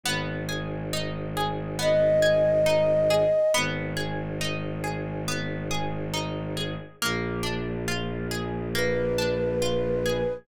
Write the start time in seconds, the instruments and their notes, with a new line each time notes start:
0.03 violin G#1, orchestral harp B3
0.49 orchestral harp G#4
0.93 orchestral harp D#4
1.37 orchestral harp G#4
1.79 orchestral harp B3, flute D#5
2.22 orchestral harp G#4
2.66 orchestral harp D#4
3.10 orchestral harp G#4
3.54 violin G#1, orchestral harp B3
3.97 orchestral harp G#4
4.41 orchestral harp D#4
4.84 orchestral harp G#4
5.28 orchestral harp B3
5.71 orchestral harp G#4
6.14 orchestral harp D#4
6.57 orchestral harp G#4
7.02 violin A#1, orchestral harp A#3
7.43 orchestral harp D4
7.88 orchestral harp F4
8.31 orchestral harp G#4
8.75 orchestral harp A#3, flute B4
9.18 orchestral harp D4
9.62 orchestral harp F4
10.06 orchestral harp G#4